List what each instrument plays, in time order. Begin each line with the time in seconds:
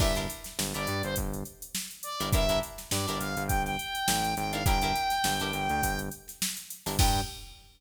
0.00 synth bass 1 G1, pizzicato strings D4 E4 G4 A#4, lead 2 (sawtooth) E5, kick, crash
0.15 pizzicato strings D4 E4 G4 A#4, closed hi-hat
0.30 closed hi-hat
0.44 snare, closed hi-hat
0.59 synth bass 1 G1, snare
0.74 synth bass 1 G1, pizzicato strings D4 E4 G4 A#4, lead 2 (sawtooth) D5, closed hi-hat
0.87 synth bass 1 G2, closed hi-hat
1.03 synth bass 1 G1, lead 2 (sawtooth) C5, snare, closed hi-hat
1.16 synth bass 1 G1, kick, closed hi-hat
1.33 closed hi-hat
1.45 closed hi-hat
1.62 closed hi-hat
1.75 snare
1.91 closed hi-hat
2.03 lead 2 (sawtooth) D5, closed hi-hat
2.20 synth bass 1 G1, pizzicato strings D4 E4 G4 A#4, closed hi-hat
2.33 synth bass 1 G1, pizzicato strings D4 E4 G4 A#4, lead 2 (sawtooth) E5, kick, closed hi-hat
2.49 pizzicato strings D4 E4 G4 A#4, closed hi-hat
2.63 closed hi-hat
2.78 snare, closed hi-hat
2.91 synth bass 1 G2, lead 2 (sawtooth) D5, snare
3.08 synth bass 1 G1, pizzicato strings D4 E4 G4 A#4, snare, closed hi-hat
3.18 synth bass 1 G1, lead 2 (sawtooth) F5, closed hi-hat
3.37 synth bass 1 G1, closed hi-hat
3.47 synth bass 1 G1, lead 2 (sawtooth) G5, kick, closed hi-hat
3.65 lead 2 (sawtooth) G5, snare, closed hi-hat
3.79 closed hi-hat
3.95 closed hi-hat
4.08 synth bass 1 A1, snare
4.24 snare, closed hi-hat
4.36 synth bass 1 G#1, lead 2 (sawtooth) G5, snare, closed hi-hat
4.52 pizzicato strings D4 E4 G4 A#4, lead 2 (sawtooth) F5, closed hi-hat
4.65 synth bass 1 G1, pizzicato strings D4 E4 G4 A#4, lead 2 (sawtooth) G5, kick, closed hi-hat
4.82 pizzicato strings D4 E4 G4 A#4, closed hi-hat
4.96 closed hi-hat
5.10 snare, closed hi-hat
5.24 synth bass 1 G1, snare
5.40 synth bass 1 G1, pizzicato strings D4 E4 G4 A#4, closed hi-hat
5.53 synth bass 1 G1, closed hi-hat
5.69 synth bass 1 D2, closed hi-hat
5.83 synth bass 1 G1, kick, closed hi-hat
5.99 closed hi-hat
6.11 closed hi-hat
6.28 snare, closed hi-hat
6.42 snare
6.57 closed hi-hat
6.70 closed hi-hat
6.86 synth bass 1 G1, pizzicato strings D4 E4 G4 A#4, snare, open hi-hat
6.99 synth bass 1 G2, pizzicato strings D4 E4 G4 A#4, lead 2 (sawtooth) G5, kick, crash